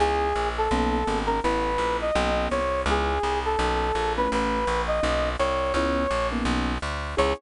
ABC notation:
X:1
M:4/4
L:1/8
Q:"Swing" 1/4=167
K:C#m
V:1 name="Brass Section"
G3 A4 ^A | B3 d3 c2 | G3 A4 B | B3 d3 c2 |
c3 z5 | c2 z6 |]
V:2 name="Acoustic Grand Piano"
[B,CEG]4 [^A,B,CD]2 [A,B,CD] [A,B,CD] | [A,B,CE]2 [A,B,CE]2 [^A,B,CD] [A,B,CD]3 | [G,B,CE]4 [^A,B,CD]3 [=A,B,CE]- | [A,B,CE]4 [^A,B,CD]4 |
[B,CEG]3 [^A,B,CD]5 | [B,CEG]2 z6 |]
V:3 name="Electric Bass (finger)" clef=bass
C,,2 ^A,,,2 B,,,2 G,,,2 | A,,,2 ^A,,,2 B,,,2 ^B,,,2 | C,,2 ^B,,,2 =B,,,2 ^A,,,2 | A,,,2 ^A,,,2 B,,,2 ^B,,,2 |
C,,2 ^A,,,2 B,,,2 =D,,2 | C,,2 z6 |]